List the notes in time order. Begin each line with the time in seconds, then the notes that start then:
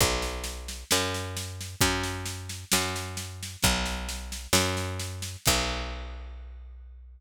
0.01 B1, kick, snare
0.22 snare
0.44 snare
0.68 snare
0.91 F#2, snare
1.14 snare
1.37 snare
1.61 snare
1.81 F#2, kick, snare
2.03 snare
2.26 snare
2.49 snare
2.72 F#2, snare
2.96 snare
3.17 snare
3.43 snare
3.63 B1, kick, snare
3.85 snare
4.09 snare
4.32 snare
4.53 F#2, snare
4.77 snare
4.99 snare
5.22 snare
5.46 B1, kick, crash